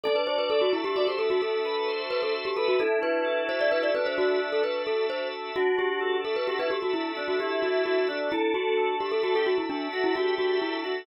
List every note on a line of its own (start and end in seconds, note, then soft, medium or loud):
0.03 0.96 D4 loud
0.03 0.15 A4 loud
0.03 0.70 D5 medium
0.16 0.26 B4 medium
0.27 1.17 F#4 medium
0.27 0.38 C5 medium
0.38 0.49 B4 medium
0.50 1.42 A4 medium
0.50 0.61 A4 loud
0.61 0.72 F#4 medium
0.73 0.84 E4 medium
0.73 1.63 E5 medium
0.84 0.95 G4 loud
0.96 1.88 D4 medium
0.96 1.07 F#4 medium
0.96 1.07 D5 medium
1.07 1.18 G4 medium
1.07 1.18 C5 medium
1.18 2.09 F#4 medium
1.18 1.29 A4 medium
1.30 1.41 F#4 loud
1.42 2.01 A4 medium
1.42 2.34 A4 medium
1.63 1.88 B4 medium
1.63 2.55 E5 medium
1.88 2.75 D4 medium
1.88 2.48 C5 medium
2.10 2.75 F#4 medium
2.10 2.21 B4 loud
2.23 2.33 A4 medium
2.35 2.78 A4 medium
2.45 2.56 G4 loud
2.56 2.67 A4 loud
2.56 2.79 B4 medium
2.56 2.78 E5 medium
2.68 2.79 F#4 loud
2.79 3.70 D4 medium
2.79 3.89 E4 medium
2.79 2.99 A4 loud
3.02 3.93 F#4 medium
3.02 3.42 B4 loud
3.25 4.16 A4 medium
3.49 3.60 C5 loud
3.49 4.41 E5 medium
3.61 3.71 D5 loud
3.70 4.63 D4 medium
3.70 3.83 B4 loud
3.83 3.94 D5 medium
3.94 4.61 D4 medium
3.94 4.85 F#4 medium
3.94 4.06 B4 loud
4.06 4.17 C5 loud
4.17 4.40 F#4 loud
4.17 5.11 A4 medium
4.42 5.32 E5 medium
4.52 4.63 A4 medium
4.63 5.51 D4 medium
4.63 4.82 B4 medium
4.86 5.51 F#4 medium
4.86 5.06 A4 medium
5.10 5.55 A4 medium
5.10 5.28 C5 loud
5.33 5.55 E5 medium
5.56 6.48 D4 medium
5.56 6.16 F#4 medium
5.56 5.78 F#4 loud
5.77 6.70 F#4 medium
5.77 6.21 G4 medium
6.00 6.93 A4 medium
6.24 6.36 A4 medium
6.24 7.16 E5 medium
6.36 6.47 B4 medium
6.48 7.40 D4 medium
6.48 6.59 F#4 medium
6.48 6.59 G4 medium
6.59 6.70 E4 medium
6.59 6.70 B4 medium
6.70 7.63 F#4 medium
6.70 6.81 G4 loud
6.82 6.93 F#4 loud
6.94 7.12 E4 loud
6.94 7.86 A4 medium
7.17 7.36 D4 medium
7.17 8.07 E5 medium
7.28 7.39 F#4 medium
7.40 8.27 D4 medium
7.40 7.98 E4 medium
7.40 7.62 G4 medium
7.62 7.82 F#4 medium
7.62 8.29 F#4 medium
7.86 8.08 F#4 loud
7.86 8.30 A4 medium
8.07 8.29 D4 medium
8.07 8.29 E5 medium
8.32 9.22 D4 medium
8.32 8.54 E4 loud
8.32 8.96 A4 medium
8.54 8.95 F#4 medium
8.54 9.45 F#4 medium
8.77 9.69 A4 medium
9.00 9.11 G4 medium
9.00 9.91 E5 medium
9.12 9.23 A4 loud
9.23 10.14 D4 medium
9.23 9.34 F#4 loud
9.23 9.34 A4 medium
9.35 9.46 G4 medium
9.35 9.46 A4 medium
9.46 10.39 F#4 medium
9.46 9.57 F#4 loud
9.58 9.69 E4 medium
9.70 9.88 D4 medium
9.70 10.61 A4 medium
9.92 10.14 F#4 medium
9.92 10.85 E5 medium
10.04 10.15 E4 loud
10.15 11.02 D4 medium
10.15 10.34 F#4 loud
10.15 10.74 G4 medium
10.38 10.58 F#4 loud
10.38 11.05 F#4 medium
10.61 10.83 E4 medium
10.61 11.05 A4 medium
10.84 11.03 F#4 medium
10.84 11.06 E5 medium